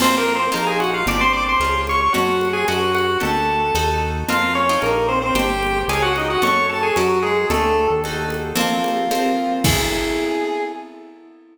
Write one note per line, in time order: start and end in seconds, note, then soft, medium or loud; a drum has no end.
0.00 0.49 F2 medium
0.00 0.49 A#3 medium
0.00 0.49 C4 medium
0.00 0.16 C4 medium
0.00 0.49 F4 medium
0.00 0.16 C5 loud
0.00 crash medium
0.00 cowbell medium
0.00 low conga medium
0.18 0.34 A#3 medium
0.18 0.34 A#4 loud
0.35 0.51 C4 medium
0.35 0.51 C5 loud
0.52 1.04 A#1 medium
0.52 1.00 A#3 medium
0.52 1.00 D#4 medium
0.52 1.00 F4 medium
0.52 0.65 A#4 medium
0.52 0.65 A#5 medium
0.52 cowbell medium
0.52 high conga medium
0.67 0.79 G#4 medium
0.67 0.79 G#5 loud
0.80 0.91 F#4 medium
0.80 0.91 F#5 medium
0.80 high conga medium
0.94 1.06 F4 medium
0.94 1.06 F5 loud
1.06 1.56 G1 loud
1.06 1.56 C4 medium
1.06 1.56 D4 medium
1.06 1.56 G4 medium
1.06 1.20 D5 loud
1.06 1.20 D6 loud
1.06 cowbell medium
1.06 low conga medium
1.21 1.32 C5 loud
1.21 1.32 C6 loud
1.33 1.44 D5 medium
1.33 1.44 D6 loud
1.49 1.82 C5 medium
1.49 1.82 C6 medium
1.60 2.09 C#2 medium
1.60 2.09 C#4 medium
1.60 2.09 F4 medium
1.60 2.09 G#4 medium
1.60 cowbell medium
1.60 high conga medium
1.87 2.00 C#5 medium
1.87 2.00 C#6 loud
1.87 high conga medium
2.01 2.14 C#5 medium
2.01 2.14 C#6 loud
2.13 2.65 F#2 medium
2.13 2.63 C#4 medium
2.13 2.48 F#4 medium
2.13 2.63 F#4 medium
2.13 2.63 A4 medium
2.13 2.48 F#5 loud
2.13 cowbell medium
2.13 low conga medium
2.41 high conga medium
2.53 2.65 G#4 loud
2.53 2.65 G#5 loud
2.68 3.17 F#2 medium
2.68 3.16 C#4 medium
2.68 3.16 F#4 medium
2.68 2.93 F#4 medium
2.68 3.16 A#4 medium
2.68 2.93 F#5 medium
2.68 cowbell medium
2.68 high conga medium
2.95 3.18 F#4 medium
2.95 3.18 F#5 medium
2.95 high conga medium
3.20 3.72 D2 medium
3.20 3.68 D4 medium
3.20 3.68 G4 medium
3.20 3.68 A4 medium
3.20 3.98 A4 medium
3.20 3.98 A5 medium
3.20 cowbell medium
3.20 low conga medium
3.74 4.24 D#2 medium
3.74 4.24 D#4 medium
3.74 4.24 F#4 medium
3.74 4.24 A4 loud
3.74 cowbell medium
3.74 high conga medium
4.28 4.78 F2 medium
4.28 4.67 C4 medium
4.28 4.67 F4 medium
4.28 4.54 F4 medium
4.28 4.67 A#4 loud
4.28 4.54 F5 loud
4.28 cowbell medium
4.28 low conga medium
4.55 4.80 C#4 medium
4.55 4.80 C#5 loud
4.69 5.31 D#4 medium
4.69 5.31 F4 medium
4.69 5.31 A#4 medium
4.82 5.32 A#1 loud
4.82 5.07 A#3 medium
4.82 5.07 A#4 medium
4.82 cowbell medium
4.82 high conga medium
5.08 5.19 C4 loud
5.08 5.19 C5 loud
5.22 5.34 C4 loud
5.22 5.34 C5 loud
5.34 5.84 G1 medium
5.34 5.83 D4 medium
5.34 5.79 G4 loud
5.34 5.83 G4 medium
5.34 5.83 C5 medium
5.34 5.79 G5 loud
5.34 cowbell medium
5.34 low conga medium
5.63 high conga medium
5.88 6.37 C#2 medium
5.88 6.38 C#4 medium
5.88 6.38 F4 medium
5.88 6.01 G#4 medium
5.88 6.38 G#4 medium
5.88 6.01 G#5 loud
5.88 cowbell medium
5.88 high conga medium
6.02 6.13 F#4 loud
6.02 6.13 F#5 loud
6.16 6.28 D#4 medium
6.16 6.28 D#5 medium
6.16 high conga medium
6.30 6.43 F#4 medium
6.30 6.43 F#5 loud
6.42 6.91 F#2 medium
6.42 6.90 C#4 medium
6.42 6.90 F#4 medium
6.42 6.90 A4 medium
6.42 6.67 C#5 loud
6.42 6.67 C#6 loud
6.42 cowbell medium
6.42 low conga medium
6.69 6.82 A4 medium
6.69 6.82 A5 loud
6.83 6.95 G#4 medium
6.83 6.95 G#5 loud
6.96 7.45 F#2 medium
6.96 7.19 F#3 medium
6.96 7.45 C#4 medium
6.96 7.19 F#4 medium
6.96 7.45 F#4 medium
6.96 7.45 A#4 medium
6.96 cowbell medium
6.96 high conga medium
7.22 7.47 G#3 medium
7.22 7.47 G#4 loud
7.49 7.88 D2 medium
7.49 7.87 A3 loud
7.49 7.99 D4 medium
7.49 7.99 G4 medium
7.49 7.87 A4 loud
7.49 7.99 A4 medium
7.49 cowbell medium
7.49 low conga medium
7.90 8.53 D#2 loud
8.04 8.53 D#4 medium
8.04 8.53 F#4 medium
8.04 8.53 A4 medium
8.04 cowbell medium
8.04 high conga medium
8.30 high conga medium
8.55 9.04 F3 medium
8.55 9.04 A#3 medium
8.55 9.04 C4 loud
8.55 9.54 F4 medium
8.55 cowbell medium
8.55 low conga medium
8.84 high conga medium
9.11 9.59 F3 medium
9.11 9.59 A#3 medium
9.11 9.59 C4 medium
9.11 cowbell medium
9.11 high conga medium
9.64 10.63 B3 medium
9.64 10.63 E4 loud
9.64 10.63 G#4 loud
9.64 10.63 A4 loud
9.64 kick loud
9.64 crash loud